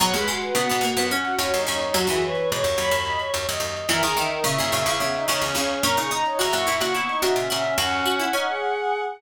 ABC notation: X:1
M:7/8
L:1/16
Q:1/4=108
K:B
V:1 name="Violin"
f b f B f f2 f3 c2 c2 | F2 B2 c z b4 z4 | e a e A e e2 e3 c2 c2 | a c' a c a c'2 c'3 e2 e2 |
f10 z4 |]
V:2 name="Choir Aahs"
c B F F F4 C F F D D D | F G c c c4 d c c d d d | A G D D E4 B, D D C C C | A G D D E4 B, D D C C C |
C4 D G5 z4 |]
V:3 name="Harpsichord"
F, G, G,2 B, B, A, B, C2 C2 C2 | F, E,9 z4 | E, D, D,2 C, C, C, C, C,2 C,2 C,2 | C D D2 F F E F E2 F2 F2 |
F2 F E C8 z2 |]
V:4 name="Pizzicato Strings" clef=bass
[G,,B,,] [D,,F,,]3 [A,,C,] [G,,B,,] [G,,B,,] [D,,F,,]3 [D,,F,,] [D,,F,,] [D,,F,,]2 | [D,,F,,] [D,,F,,]3 [G,,B,,] [D,,F,,] [D,,F,,] [D,,F,,]3 [D,,F,,] [D,,F,,] [D,,F,,]2 | [F,,A,,] [C,,E,,]3 [A,,C,] [F,,A,,] [F,,A,,] [C,,E,,]3 [C,,E,,] [C,,E,,] [C,,E,,]2 | [F,,A,,] [A,,C,]3 [C,,E,,] [F,,A,,] [F,,A,,] [A,,C,]3 [A,,C,] [A,,C,] [A,,C,]2 |
[D,,F,,]10 z4 |]